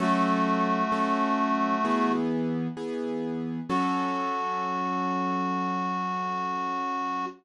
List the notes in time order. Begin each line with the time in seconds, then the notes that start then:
0.00 F#3 A3 C#4 F#4 A4
0.92 F#3 C#4 A4
1.85 E3 B3 G#4
2.77 E3 B3 G#4
3.69 F#3 C#4 F#4 A4